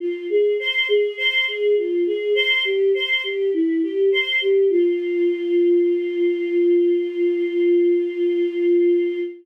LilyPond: \new Staff { \time 4/4 \key f \minor \tempo 4 = 51 f'16 aes'16 c''16 aes'16 c''16 aes'16 f'16 aes'16 c''16 g'16 c''16 g'16 e'16 g'16 c''16 g'16 | f'1 | }